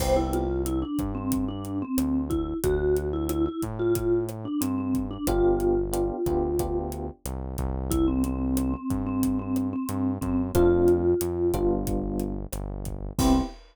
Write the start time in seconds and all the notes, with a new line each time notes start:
0.00 C2 B3 C4 E4 G4 C5, kick, cross-stick, crash
0.16 E4
0.33 F4, closed hi-hat
0.66 E4, closed hi-hat
0.82 D4
0.99 G2, kick, cross-stick, closed hi-hat
1.15 C4
1.32 kick, closed hi-hat
1.48 D4
1.65 closed hi-hat
1.82 C4
1.98 D2, cross-stick, closed hi-hat
2.30 E4, kick, closed hi-hat
2.64 D2 F#4, kick, closed hi-hat
2.97 closed hi-hat
3.13 E4
3.29 E4, cross-stick, closed hi-hat
3.46 E4
3.62 A2, kick, closed hi-hat
3.79 F4
3.95 kick, closed hi-hat
4.29 cross-stick, closed hi-hat
4.45 D4
4.61 G2 C4, closed hi-hat
4.78 C4
4.94 kick, closed hi-hat
5.11 D4
5.27 G1 B3 D4 F4 G4, kick, cross-stick, closed hi-hat
5.60 closed hi-hat
5.93 B3 D4 F4 G4, closed hi-hat
6.26 D2 B3 D4 F4 G4, kick, cross-stick, closed hi-hat
6.59 B3 D4 F4 G4, kick, closed hi-hat
6.92 closed hi-hat
7.25 C2, cross-stick, closed hi-hat
7.58 C2, kick, closed hi-hat
7.91 E4, kick, closed hi-hat
8.08 C4
8.24 C4, closed hi-hat
8.57 C4, cross-stick, closed hi-hat
8.74 C4
8.90 G2, kick, closed hi-hat
9.06 C4
9.23 kick, closed hi-hat
9.39 C4
9.56 cross-stick, closed hi-hat
9.73 C4
9.89 G2, closed hi-hat
10.21 F#2 C4, kick, closed hi-hat
10.55 F2 A3 C4 D4 F4, kick, cross-stick, closed hi-hat
10.88 closed hi-hat
11.21 F2, closed hi-hat
11.53 G1 G3 B3 D4 F4, kick, cross-stick, closed hi-hat
11.87 kick, closed hi-hat
12.20 closed hi-hat
12.53 G1, cross-stick, closed hi-hat
12.85 kick, closed hi-hat
13.19 C2 B3 C4 E4 G4, kick, crash